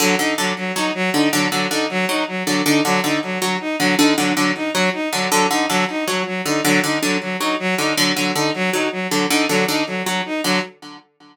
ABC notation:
X:1
M:7/8
L:1/8
Q:1/4=158
K:none
V:1 name="Orchestral Harp" clef=bass
D, D, D, z ^F, z D, | D, D, D, z ^F, z D, | D, D, D, z ^F, z D, | D, D, D, z ^F, z D, |
D, D, D, z ^F, z D, | D, D, D, z ^F, z D, | D, D, D, z ^F, z D, | D, D, D, z ^F, z D, |]
V:2 name="Violin"
^F, ^D F, F, D F, D | ^F, F, ^D F, D F, F, | ^D ^F, D F, F, D F, | ^D ^F, F, D F, D F, |
^F, ^D F, D F, F, D | ^F, ^D F, F, D F, D | ^F, F, ^D F, D F, F, | ^D ^F, D F, F, D F, |]